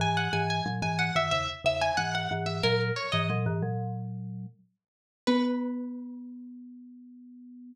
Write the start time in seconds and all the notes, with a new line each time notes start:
0.00 G#2 E3 G#5
0.17 F#5
0.33 G#2 E3 G#5
0.50 G#5
0.66 A#2 F#3
0.82 G#2 E3 G#5
0.99 F#5
1.15 F#2 D#3 E5
1.31 E2 C#3 E5
1.64 E2 C#3 E5
1.81 G#5
1.97 G#2 E3 F#5
2.15 F#5
2.31 G#2 E3
2.46 E5
2.63 A#2 F#3 A#4
2.96 C#5
3.12 G#2 E3 D#5
3.30 A#2 F#3
3.46 G#2 E3
3.63 A#2 F#3
5.27 B3 B4